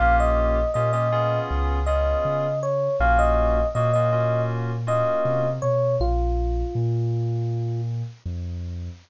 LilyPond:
<<
  \new Staff \with { instrumentName = "Electric Piano 1" } { \time 4/4 \key bes \minor \tempo 4 = 80 f''16 ees''8. ees''16 ees''8. r8 ees''4 des''8 | f''16 ees''8. ees''16 ees''8. r8 ees''4 des''8 | f'2~ f'8 r4. | }
  \new Staff \with { instrumentName = "Electric Piano 2" } { \time 4/4 \key bes \minor <bes des' f' g'>4 <bes des' f' g'>16 <bes des' f' g'>16 <ces' des' f' aes'>4 <ces' des' f' aes'>4. | <bes des' f' ges'>4 <bes des' f' ges'>16 <bes des' f' ges'>16 <bes des' f' ges'>4 <bes des' f' ges'>4. | r1 | }
  \new Staff \with { instrumentName = "Synth Bass 2" } { \clef bass \time 4/4 \key bes \minor bes,,4 bes,4 des,4 des4 | bes,,4 bes,2 c8 b,8 | bes,,4 bes,2 f,4 | }
>>